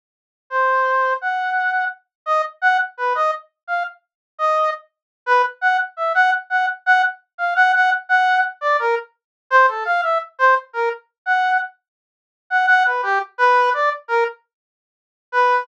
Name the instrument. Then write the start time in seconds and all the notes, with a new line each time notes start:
brass section
0.50 C5
1.21 F#5
2.26 D#5
2.62 F#5
2.97 B4
3.15 D#5
3.67 F5
4.39 D#5
5.26 B4
5.61 F#5
5.97 E5
6.15 F#5
6.50 F#5
6.86 F#5
7.38 F5
7.56 F#5
7.74 F#5
8.09 F#5
8.61 D5
8.79 A#4
9.50 C5
9.68 A4
9.85 F5
10.02 E5
10.39 C5
10.73 A#4
11.26 F#5
12.50 F#5
12.68 F#5
12.86 B4
13.03 G4
13.38 B4
13.74 D5
14.08 A#4
15.32 B4